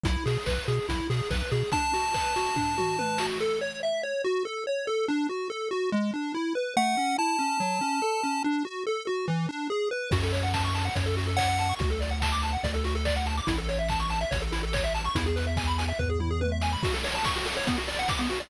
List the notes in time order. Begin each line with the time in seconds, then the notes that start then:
0.04 B1 E4, kick, closed hi-hat
0.26 B2 G#4, open hi-hat
0.46 B1 B4, kick, clap
0.68 B2 G#4, open hi-hat
0.89 B1 E4, kick, closed hi-hat
1.10 B2 G#4, open hi-hat
1.31 B1 B4, kick, clap
1.51 B2 G#4, open hi-hat
1.72 D4 A5, kick, closed hi-hat
1.93 F#4, open hi-hat
2.14 B4, kick, clap
2.36 F#4, open hi-hat
2.56 D4, kick, floor tom
2.78 F#4, mid tom
2.99 B4, high tom
3.18 F#4, snare
3.40 A4
3.61 C#5
3.83 E5
4.03 C#5
4.24 F#4
4.45 A4
4.67 C#5
4.87 A4
5.08 D4
5.29 F#4
5.50 A4
5.71 F#4
5.92 G#3
6.14 D4
6.35 E4
6.55 B4
6.77 A3 F#5
6.97 C#4
7.18 E4 A5
7.39 C#4
7.60 F#3
7.81 C#4
8.02 A4
8.23 C#4
8.44 D4
8.65 F#4
8.87 A4
9.07 F#4
9.28 E3
9.49 D4
9.70 G#4
9.91 B4
10.11 F#2 F#4, kick, crash
10.23 A4, closed hi-hat
10.33 C#5, open hi-hat
10.42 F#5, closed hi-hat
10.54 A5, kick, snare
10.64 C#6, closed hi-hat
10.75 A5, open hi-hat
10.85 F#5, closed hi-hat
10.95 F#2 C#5, kick, closed hi-hat
11.06 A4, closed hi-hat
11.17 F#4, open hi-hat
11.27 A4, closed hi-hat
11.37 C#5 F#5, kick, clap
11.48 F#5, closed hi-hat
11.58 A5, open hi-hat
11.69 C#6, closed hi-hat
11.79 D2 F#4, kick, closed hi-hat
11.90 A4, closed hi-hat
12.01 D5, open hi-hat
12.11 F#5, closed hi-hat
12.22 A5, kick, clap
12.32 D6, closed hi-hat
12.42 A5, open hi-hat
12.53 F#5, closed hi-hat
12.63 D2 D5, kick, closed hi-hat
12.74 A4, closed hi-hat
12.84 F#4, open hi-hat
12.95 A4, closed hi-hat
13.05 D5, kick, clap
13.16 F#5, closed hi-hat
13.26 A5, open hi-hat
13.37 D6, closed hi-hat
13.47 A1 E4, kick, closed hi-hat
13.57 A4, closed hi-hat
13.69 C#5, open hi-hat
13.79 E5, closed hi-hat
13.89 A5, kick, clap
13.99 C#6, closed hi-hat
14.10 A5, open hi-hat
14.21 E5, closed hi-hat
14.31 A1 C#5, kick, closed hi-hat
14.41 A4, closed hi-hat
14.52 E4, open hi-hat
14.63 A4, closed hi-hat
14.73 C#5, kick, clap
14.84 E5, closed hi-hat
14.94 A5, open hi-hat
15.04 C#6, closed hi-hat
15.15 E2 E4, kick, closed hi-hat
15.26 G#4, closed hi-hat
15.36 B4, open hi-hat
15.47 E5, closed hi-hat
15.57 G#5, kick, clap
15.67 B5, closed hi-hat
15.78 G#5, open hi-hat
15.88 E5, closed hi-hat
15.99 E2 B4, kick, floor tom
16.10 G#4
16.20 E4, mid tom
16.31 G#4
16.41 B4, high tom
16.52 E5
16.62 G#5, snare
16.73 B5
16.83 F#4, kick, crash
16.94 A4, closed hi-hat
17.04 C#5, open hi-hat
17.14 A5, closed hi-hat
17.24 C#6, kick, snare
17.35 F#4, closed hi-hat
17.45 A4, open hi-hat
17.56 C#5, closed hi-hat
17.67 B3, kick, closed hi-hat
17.77 F#4, closed hi-hat
17.88 D5, open hi-hat
17.99 F#5, closed hi-hat
18.08 D6, kick, snare
18.19 B3, closed hi-hat
18.30 F#4, open hi-hat
18.40 D5, closed hi-hat